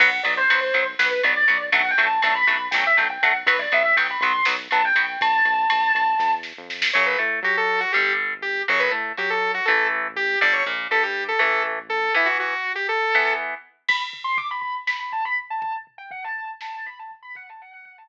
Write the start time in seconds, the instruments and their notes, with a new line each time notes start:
0.00 synth bass 1 B1, overdriven guitar F#3 B3, distortion guitar F#5, kick, crash
0.23 synth bass 1 B1, overdriven guitar F#3 B3, distortion guitar D5, ride
0.37 distortion guitar C5
0.50 synth bass 1 B1, overdriven guitar F#3 B3, ride
0.61 distortion guitar C5
0.74 synth bass 1 B1, overdriven guitar F#3 B3, ride
0.99 synth bass 1 B1, overdriven guitar F#3 B3, distortion guitar B4, snare
1.23 synth bass 1 B1, overdriven guitar F#3 B3, distortion guitar D5, ride
1.48 synth bass 1 B1, overdriven guitar F#3 B3, ride
1.72 synth bass 1 B1, overdriven guitar F#3 A3 D4, distortion guitar F#5, kick, ride
1.91 distortion guitar G5
1.98 synth bass 1 B1, overdriven guitar F#3 A3 D4, ride
2.05 distortion guitar A5
2.22 synth bass 1 B1, overdriven guitar F#3 A3 D4, distortion guitar A5, ride
2.34 distortion guitar B5
2.47 synth bass 1 B1, overdriven guitar F#3 A3 D4, ride
2.71 synth bass 1 B1, overdriven guitar F#3 A3 D4, distortion guitar G5, snare
2.87 distortion guitar E5
2.97 synth bass 1 B1, overdriven guitar F#3 A3 D4, distortion guitar G5, ride
3.10 distortion guitar G5
3.22 synth bass 1 B1, overdriven guitar F#3 A3 D4, distortion guitar F#5, ride
3.46 synth bass 1 B1, overdriven guitar F#3 B3, distortion guitar B4, kick, ride
3.59 distortion guitar D5
3.72 synth bass 1 B1, overdriven guitar F#3 B3, distortion guitar E5, ride
3.96 synth bass 1 B1, overdriven guitar F#3 B3, distortion guitar G5, ride
4.10 distortion guitar B5
4.21 synth bass 1 B1, overdriven guitar F#3 B3, distortion guitar C6, ride
4.45 synth bass 1 B1, overdriven guitar F#3 B3, snare
4.71 synth bass 1 B1, overdriven guitar F#3 B3, distortion guitar A5, ride
4.85 distortion guitar G5
4.95 synth bass 1 B1, overdriven guitar F#3 B3, distortion guitar G5, ride
5.20 synth bass 1 B1, distortion guitar A5, kick, ride
5.45 synth bass 1 B1, ride
5.70 synth bass 1 B1, ride
5.94 synth bass 1 B1, ride
6.19 synth bass 1 E2, kick, snare
6.43 snare
6.57 synth bass 1 F2
6.70 snare
6.82 snare
6.93 synth bass 1 F#2, overdriven guitar C#3 F#3, lead 2 (sawtooth) C#5
7.06 lead 2 (sawtooth) B4
7.18 synth bass 1 A2, overdriven guitar A3
7.43 synth bass 1 F#3, overdriven guitar F#4, lead 2 (sawtooth) G4
7.57 lead 2 (sawtooth) A4
7.80 lead 2 (sawtooth) F#4
7.92 synth bass 1 G1, overdriven guitar D3 G3, lead 2 (sawtooth) G4
8.42 lead 2 (sawtooth) G4
8.68 synth bass 1 F#2, overdriven guitar C#3 F#3, lead 2 (sawtooth) C#5
8.80 lead 2 (sawtooth) B4
8.91 synth bass 1 A2, overdriven guitar A3
9.17 synth bass 1 F#3, overdriven guitar F#4, lead 2 (sawtooth) G4
9.30 lead 2 (sawtooth) A4
9.54 lead 2 (sawtooth) F#4
9.65 synth bass 1 A1, overdriven guitar E3 A3, lead 2 (sawtooth) A4
10.16 lead 2 (sawtooth) G4
10.41 synth bass 1 G1, overdriven guitar D3 G3, lead 2 (sawtooth) D5
10.53 lead 2 (sawtooth) C#5
10.66 synth bass 1 A#1, overdriven guitar A#2
10.91 synth bass 1 G2, overdriven guitar G3, lead 2 (sawtooth) A4
11.03 lead 2 (sawtooth) G4
11.28 lead 2 (sawtooth) A4
11.39 synth bass 1 A1, overdriven guitar E3 A3, lead 2 (sawtooth) A4
11.89 lead 2 (sawtooth) A4
12.14 overdriven guitar E3 B3, lead 2 (sawtooth) E4
12.26 lead 2 (sawtooth) F#4
12.40 lead 2 (sawtooth) F#4
12.75 lead 2 (sawtooth) G4
12.89 lead 2 (sawtooth) A4
13.15 overdriven guitar E3 B3
13.88 distortion guitar B5, kick, crash
14.13 floor tom
14.24 distortion guitar C6
14.38 distortion guitar D6, floor tom
14.51 distortion guitar B5
14.61 distortion guitar B5, floor tom
14.87 distortion guitar B5, snare
15.00 distortion guitar B5
15.12 distortion guitar A5, floor tom
15.25 distortion guitar B5
15.37 floor tom
15.50 distortion guitar A5
15.61 distortion guitar A5, kick, floor tom
15.87 floor tom
15.98 distortion guitar G5
16.11 distortion guitar F#5, floor tom
16.24 distortion guitar A5
16.36 distortion guitar A5, floor tom
16.61 distortion guitar A5, snare
16.75 distortion guitar A5
16.86 distortion guitar B5, floor tom
16.99 distortion guitar A5
17.11 floor tom
17.23 distortion guitar B5
17.35 distortion guitar F#5, kick, floor tom
17.49 distortion guitar A5
17.61 distortion guitar F#5, floor tom
17.73 distortion guitar F#5
17.85 distortion guitar F#5, floor tom
17.98 distortion guitar A5